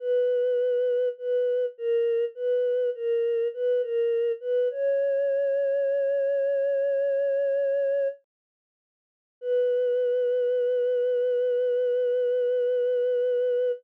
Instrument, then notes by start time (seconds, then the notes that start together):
choir aahs
0.00 B4
1.18 B4
1.78 A#4
2.35 B4
2.95 A#4
3.54 B4
3.81 A#4
4.40 B4
4.70 C#5
9.41 B4